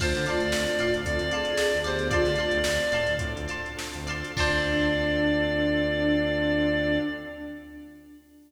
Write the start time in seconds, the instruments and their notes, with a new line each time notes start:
0.00 synth bass 1 D2, choir aahs A3 F4, drawbar organ C4 D4 F4 A4, pad 5 (bowed) C4 D4 F4 A4, clarinet C5, acoustic guitar (steel) D5 F5 A5 C6, kick, crash
0.15 synth bass 1 D3, snare, closed hi-hat
0.26 acoustic guitar (steel) D5 F5 A5 C6, clarinet D5, closed hi-hat
0.40 synth bass 1 D2, closed hi-hat
0.52 synth bass 1 D2, drawbar organ C4 D4 F4 A4, snare
0.67 closed hi-hat
0.79 synth bass 1 A2, acoustic guitar (steel) D5 F5 A5 C6, closed hi-hat
0.94 synth bass 1 D2, closed hi-hat
1.05 synth bass 1 D2, choir aahs C4 A4, drawbar organ C4 D4 F4 A4, clarinet D5, kick, closed hi-hat
1.19 synth bass 1 D2, snare, closed hi-hat
1.31 choir aahs G#4, acoustic guitar (steel) D5 F5 A5 C6, closed hi-hat
1.45 closed hi-hat
1.57 drawbar organ C4 D4 F4 A4, snare
1.72 synth bass 1 D2, closed hi-hat
1.84 synth bass 1 D2, choir aahs B3 G4, clarinet C5, acoustic guitar (steel) D5 F5 A5 C6, closed hi-hat
1.99 closed hi-hat
2.11 choir aahs A3 F4, drawbar organ C4 D4 F4 A4, pad 5 (bowed) C4 D4 F4 A4, acoustic guitar (steel) D5 F5 A5 C6, clarinet D5, kick, closed hi-hat
2.25 synth bass 1 D3, snare, closed hi-hat
2.36 acoustic guitar (steel) D5 F5 A5, closed hi-hat
2.40 acoustic guitar (steel) C6
2.51 synth bass 1 D2, closed hi-hat
2.64 synth bass 1 D2, drawbar organ C4 D4 F4 A4, snare
2.80 closed hi-hat
2.92 synth bass 1 A2, acoustic guitar (steel) D5 F5 A5 C6, closed hi-hat
3.07 synth bass 1 D2, closed hi-hat
3.19 synth bass 1 A2, drawbar organ C4 D4 F4 A4, kick, closed hi-hat
3.36 synth bass 1 D2, closed hi-hat
3.48 acoustic guitar (steel) D5 F5 A5 C6, closed hi-hat
3.66 closed hi-hat
3.77 drawbar organ C4 D4 F4 A4, snare
3.93 synth bass 1 D2, closed hi-hat
4.07 synth bass 1 D2, acoustic guitar (steel) D5 F5 A5 C6, closed hi-hat
4.24 closed hi-hat
4.36 synth bass 1 D2, drawbar organ C4 D4 F4 A4, pad 5 (bowed) C4 D4 F4 A4, acoustic guitar (steel) D4 F4 A4 C5, choir aahs D4, clarinet D5, kick, crash